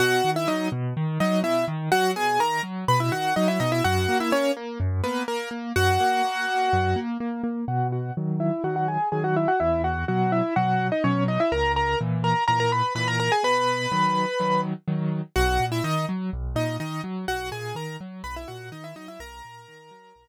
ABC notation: X:1
M:4/4
L:1/16
Q:1/4=125
K:B
V:1 name="Acoustic Grand Piano"
[Ff]3 [Ee] [Dd]2 z4 [Dd]2 [Ee]2 z2 | [Ff]2 [Gg]2 [Aa]2 z2 [Bb] [Ee] [Ff]2 [Dd] [Ee] [Dd] [Ee] | [Ff]3 [Ee] [Cc]2 z4 [B,B]2 [A,A]2 z2 | [Ff]12 z4 |
[Ff]2 [Ff]2 z2 [Ee]2 [Ff] [Ff] [Gg]2 [Gg] [Ff] [Ee] [Ff] | [Ee]2 [Ff]2 [Ff]2 [Ee]2 [Ff]3 [Dd] [Cc]2 [Dd] [Ee] | [Aa]2 [Aa]2 z2 [Aa]2 [Aa] [Aa] [Bb]2 [Bb] [Aa] [Aa] [Gg] | [Bb]10 z6 |
[Ff]3 [Ee] [Dd]2 z4 [Dd]2 [Dd]2 z2 | [Ff]2 [Gg]2 [Aa]2 z2 [Bb] [Ee] [Ff]2 [Dd] [Ee] [Dd] [Ee] | [Aa]12 z4 |]
V:2 name="Acoustic Grand Piano"
B,,2 D,2 F,2 B,,2 D,2 F,2 B,,2 D,2 | F,2 B,,2 D,2 F,2 B,,2 D,2 F,2 B,,2 | F,,2 A,2 A,2 A,2 F,,2 A,2 z2 A,2 | F,,2 A,2 A,2 A,2 F,,2 A,2 A,2 A,2 |
B,,4 [D,F,]4 [D,F,]4 [D,F,]4 | E,,4 [B,,F,]4 [B,,F,]4 [B,,F,]4 | C,,4 [A,,E,]4 [A,,E,]4 [A,,E,]4 | B,,4 [D,F,]4 [D,F,]4 [D,F,]4 |
B,,,2 A,,2 D,2 F,2 B,,,2 A,,2 D,2 F,2 | B,,,2 A,,2 D,2 F,2 B,,,2 A,,2 D,2 F,2 | B,,,2 A,,2 D,2 F,2 B,,,2 z6 |]